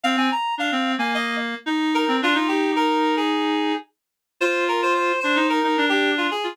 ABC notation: X:1
M:4/4
L:1/16
Q:1/4=110
K:Fdor
V:1 name="Clarinet"
f a b2 f3 a e2 z4 B2 | F F G2 B3 A5 z4 | c2 B c c2 c2 B3 G2 F A2 |]
V:2 name="Clarinet"
C C z2 D C2 B,5 E3 C | D E11 z4 | F6 D E2 E D D3 z F |]